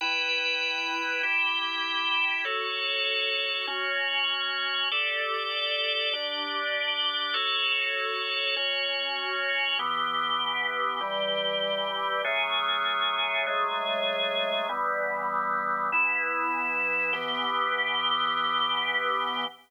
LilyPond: \new Staff { \time 12/8 \key e \dorian \tempo 4. = 98 <e' b' g''>2. <e' g' g''>2. | <fis' a' cis''>2. <cis' fis' cis''>2. | <g' a' d''>2. <d' g' d''>2. | <fis' a' cis''>2. <cis' fis' cis''>2. |
<e b g'>2. <e g g'>2. | <fis a cis' gis'>2. <fis gis a gis'>2. | <e g b>2. <e b e'>2. | <e b g'>1. | }